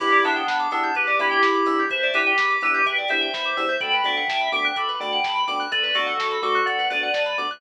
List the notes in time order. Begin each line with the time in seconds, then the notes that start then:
0.00 E2 B3 D4 E4 G4 B4, kick, crash
0.12 D5, closed hi-hat
0.23 E2 B3 D4 E4 G4 E5, open hi-hat
0.36 G5, closed hi-hat
0.48 E2 B5, kick, snare
0.59 D6, closed hi-hat
0.71 E2 B3 D4 E4 G4 E6, open hi-hat
0.83 G6, closed hi-hat
0.95 E2 G4 B4, kick, closed hi-hat
1.07 D5, closed hi-hat
1.19 E2 B3 D4 E4 G4 E5, open hi-hat
1.31 G5, closed hi-hat
1.43 E2 B5, kick, snare
1.54 D6, closed hi-hat
1.66 E2 B3 D4 E4 G4 E6, open hi-hat
1.78 G6, closed hi-hat
1.90 E2 B4 C5 E5, kick, closed hi-hat
2.03 D5, closed hi-hat
2.14 E2 B3 D4 E4 G4 B4 E5, open hi-hat
2.26 G5, closed hi-hat
2.38 E2 B5, kick, snare
2.50 D6, closed hi-hat
2.61 E2 B3 D4 E4 G4 B4 E6, open hi-hat
2.74 G6, closed hi-hat
2.86 E2 B4 E5 G5, kick, closed hi-hat
2.97 D5, closed hi-hat
3.08 E2 B3 D4 E4 G4 C5 E5, open hi-hat
3.21 G5, closed hi-hat
3.34 E2 B5, kick, snare
3.44 D6, closed hi-hat
3.57 E2 B3 D4 E4 G4 E6, open hi-hat
3.69 G6, closed hi-hat
3.81 D2 A3 B3 D4 F#4 A4 G5 B5, kick, closed hi-hat
3.92 B4, closed hi-hat
4.04 D2 A3 B3 D4 F#4 D5 E5 G5, open hi-hat
4.17 F#5, closed hi-hat
4.28 D2 A5, kick, snare
4.39 B5, closed hi-hat
4.52 D2 A3 B3 D4 F#4 E5 G5 D6, open hi-hat
4.64 F#6, closed hi-hat
4.76 D2 A4 B5 D6, kick, closed hi-hat
4.88 B4, closed hi-hat
5.00 D2 A3 B3 D4 F#4 D5 G5 B5, open hi-hat
5.11 F#5, closed hi-hat
5.24 D2 A5, kick, snare
5.35 B5, closed hi-hat
5.47 D2 A3 B3 D4 F#4 D6, open hi-hat
5.60 F#6, closed hi-hat
5.71 D2 A4 B4 D5, kick, closed hi-hat
5.83 B4, closed hi-hat
5.95 D2 A3 B3 D4 F#4 A4 D5, open hi-hat
6.06 F#5, closed hi-hat
6.18 D2 A5, kick, snare
6.31 B5, closed hi-hat
6.42 D2 A3 B3 D4 F#4 A4 D6, open hi-hat
6.55 F#6, closed hi-hat
6.65 D2 A4 D5 F#5, kick, closed hi-hat
6.78 B4, closed hi-hat
6.90 D2 A3 B3 D4 F#4 B4 D5, open hi-hat
7.02 F#5, closed hi-hat
7.14 D2 A5, kick, snare
7.26 B5, closed hi-hat
7.38 D2 A3 B3 D4 F#4 D6, open hi-hat
7.50 F#6, closed hi-hat